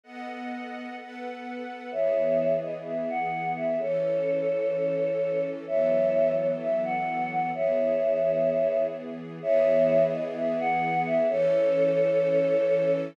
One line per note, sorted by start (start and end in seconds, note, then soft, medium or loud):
0.04 0.96 B3 medium
0.04 0.96 A4 medium
0.04 0.96 D#5 medium
0.04 0.96 F#5 medium
0.98 1.91 B3 medium
0.98 1.91 A4 medium
0.98 1.91 B4 medium
0.98 1.91 F#5 medium
1.91 3.77 E3 medium
1.91 3.77 B3 medium
1.91 3.77 G#4 medium
1.91 2.52 C#5 medium
1.91 2.52 E5 medium
2.62 2.73 D#5 medium
2.85 3.08 E5 medium
3.09 3.48 F#5 medium
3.56 3.79 E5 medium
3.79 5.65 E3 medium
3.79 5.65 C#4 medium
3.79 5.65 A4 medium
3.79 5.41 A4 medium
3.79 5.41 C#5 medium
5.66 7.51 E3 medium
5.66 7.51 F#3 medium
5.66 7.51 B3 medium
5.66 7.51 A4 medium
5.66 6.32 C#5 medium
5.66 6.32 E5 medium
6.37 6.48 C#5 medium
6.61 6.81 E5 medium
6.84 7.27 F#5 medium
7.31 7.50 F#5 medium
7.54 9.39 E3 medium
7.54 9.39 B3 medium
7.54 9.39 G#4 medium
7.54 8.81 C#5 medium
7.54 8.81 E5 medium
9.41 11.27 E3 medium
9.41 11.27 B3 medium
9.41 11.27 G#4 medium
9.41 10.02 C#5 medium
9.41 10.02 E5 medium
10.12 10.23 D#5 medium
10.35 10.58 E5 medium
10.59 10.98 F#5 medium
11.06 11.28 E5 medium
11.29 13.14 E3 loud
11.29 13.14 C#4 medium
11.29 12.91 A4 medium
11.29 13.14 A4 loud
11.29 12.91 C#5 medium